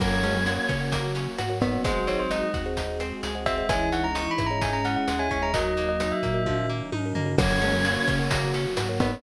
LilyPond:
<<
  \new Staff \with { instrumentName = "Tubular Bells" } { \time 4/4 \key fis \mixolydian \tempo 4 = 130 fis8 gis16 fis16 ais8 r2 b8 | bis'8 cis''16 bis'16 dis''8 r2 e''8 | gis''8 fis''16 ais''16 \tuplet 3/2 { cis'''8 b''8 ais''8 } gis''16 ais''16 fis''16 fis''8 gis''16 gis''16 ais''16 | dis''8. dis''8 e''4~ e''16 r4. |
fis8 gis16 fis16 ais8 r2 b8 | }
  \new Staff \with { instrumentName = "Choir Aahs" } { \time 4/4 \key fis \mixolydian cis''2 fis'4. dis'16 cis'16 | fis4. r2 r8 | e4 e8. e16 cis'2 | fis2~ fis8 r4. |
cis''2 fis'4. dis'16 cis'16 | }
  \new Staff \with { instrumentName = "Harpsichord" } { \time 4/4 \key fis \mixolydian ais8 cis'8 fis'8 cis'8 ais8 cis'8 fis'8 b8 | gis8 bis8 dis'8 fis'8 dis'8 bis8 gis8 bis8 | gis8 cis'8 dis'8 e'8 dis'8 cis'8 gis8 cis'8 | fis8 ais8 dis'8 ais8 f8 ais8 dis'8 ais8 |
ais8 cis'8 fis'8 cis'8 ais8 cis'8 fis'8 b8 | }
  \new Staff \with { instrumentName = "Kalimba" } { \time 4/4 \key fis \mixolydian <ais' cis'' fis''>4.~ <ais' cis'' fis''>16 <ais' cis'' fis''>4. <ais' cis'' fis''>16 <ais' cis'' fis''>16 <ais' cis'' fis''>16 | <gis' bis' dis'' fis''>4.~ <gis' bis' dis'' fis''>16 <gis' bis' dis'' fis''>4. <gis' bis' dis'' fis''>16 <gis' bis' dis'' fis''>16 <gis' bis' dis'' fis''>16 | <gis' cis'' dis'' e''>4.~ <gis' cis'' dis'' e''>16 <gis' cis'' dis'' e''>4. <gis' cis'' dis'' e''>16 <gis' cis'' dis'' e''>16 <gis' cis'' dis'' e''>16 | <fis' ais' dis''>4.~ <fis' ais' dis''>16 <fis' ais' dis''>4. <fis' ais' dis''>16 <fis' ais' dis''>16 <fis' ais' dis''>16 |
<ais' cis'' fis''>4.~ <ais' cis'' fis''>16 <ais' cis'' fis''>4. <ais' cis'' fis''>16 <ais' cis'' fis''>16 <ais' cis'' fis''>16 | }
  \new Staff \with { instrumentName = "Synth Bass 1" } { \clef bass \time 4/4 \key fis \mixolydian fis,4. cis4. gis,4 | gis,,4. dis,4. cis,4 | cis,4. gis,4. dis,8 dis,8~ | dis,4. ais,4. gis,8 g,8 |
fis,4. cis4. gis,4 | }
  \new Staff \with { instrumentName = "String Ensemble 1" } { \time 4/4 \key fis \mixolydian <ais cis' fis'>2 <fis ais fis'>2 | <gis bis dis' fis'>2 <gis bis fis' gis'>2 | <gis cis' dis' e'>2 <gis cis' e' gis'>2 | <fis ais dis'>2 <dis fis dis'>2 |
<ais cis' fis'>2 <fis ais fis'>2 | }
  \new DrumStaff \with { instrumentName = "Drums" } \drummode { \time 4/4 <cymc bd ss>8 <hh sn>8 hh8 <hh bd ss>8 <hh bd>8 hh8 <hh ss>8 <hh bd>8 | <hh bd>8 <hh sn>8 <hh ss>8 <hh bd>8 <hh bd>8 <hh ss>8 hh8 <hh bd>8 | <hh bd ss>8 <hh sn>8 hh8 <hh bd ss>8 <hh bd>8 hh8 <hh ss>8 <hh bd>8 | <hh bd>8 <hh sn>8 <hh ss>8 <hh bd>8 <bd tommh>4 tommh8 tomfh8 |
<cymc bd ss>8 <hh sn>8 hh8 <hh bd ss>8 <hh bd>8 hh8 <hh ss>8 <hh bd>8 | }
>>